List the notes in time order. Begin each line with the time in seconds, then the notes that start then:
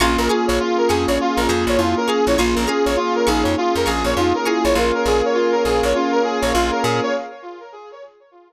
0.00 A#1 A#3 C#4 F4 G#4 F5 G#5 A#5 C#6
0.18 A#1 A#4
0.28 F4 G#4 F5 G#5 A#5 C#6
0.47 A#1 C#5
0.60 F4
0.77 A#4
0.88 F2 G#4 F5 G#5 A#5 C#6
1.07 A#1 C#5
1.18 F4
1.37 A#1 A#4
1.47 F2 G#4 F5 G#5 A#5 C#6
1.67 A#1 C#5
1.77 F2 E4 F4
1.97 A#4
2.07 G#4 F5 G#5 A#5 C#6
2.26 A#1 E4 C#5
2.36 A#1 A#3 C#4 F4 G#4 F5 G#5 A#5 C#6
2.55 A#1 A#4
2.67 C#4 G#4 F5 G#5 A#5 C#6
2.85 A#1 C#5
2.96 F4
3.15 A#4
3.26 A#1 D#4 G#4 F5 G#5 A#5 C#6
3.43 F2 C#5
3.58 F4
3.75 F2 A#4
3.86 A#1 G#4 F5 G#5 A#5 C#6
4.04 A#1 C#5
4.16 F2 D#4 F4
4.35 A#4
4.45 E4 G#4 F5 G#5 A#5 C#6
4.64 A#1 C#5
4.75 A#1 A#3 C#4 F4 G#4 A#4 C#5 F5 G#5
4.94 A#4
5.06 A#1 G#4
5.25 C#5
5.34 F4
5.52 A#4
5.65 A#1 G#4
5.83 A#1 C#5
5.94 C#4 F4
6.12 A#4
6.23 G#4
6.42 A#1 C#5
6.53 A#1 F4
6.71 A#4
6.83 A#2 G#4
7.03 C#5